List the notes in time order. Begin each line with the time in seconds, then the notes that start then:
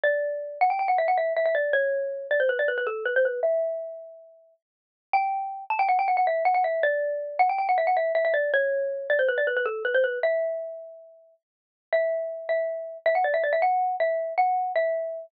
0.04 D5
0.61 F#5
0.70 G5
0.79 G5
0.88 F#5
0.98 E5
1.08 F#5
1.18 E5
1.37 E5
1.46 E5
1.55 D5
1.73 C#5
2.31 D5
2.40 C5
2.49 B4
2.59 D5
2.68 B4
2.78 B4
2.87 A4
3.06 B4
3.16 C5
3.25 B4
3.43 E5
5.13 G5
5.70 A5
5.79 G5
5.89 F#5
5.99 G5
6.08 F#5
6.17 F#5
6.27 E5
6.45 F#5
6.54 F#5
6.64 E5
6.83 D5
7.39 F#5
7.49 G5
7.58 G5
7.69 F#5
7.78 E5
7.87 F#5
7.97 E5
8.15 E5
8.25 E5
8.34 D5
8.54 C#5
9.10 D5
9.19 C5
9.29 B4
9.38 D5
9.47 B4
9.57 B4
9.66 A4
9.85 B4
9.94 C5
10.04 B4
10.23 E5
11.93 E5
12.49 E5
13.06 E5
13.15 F#5
13.24 D5
13.34 E5
13.44 D5
13.53 E5
13.62 F#5
14.00 E5
14.38 F#5
14.76 E5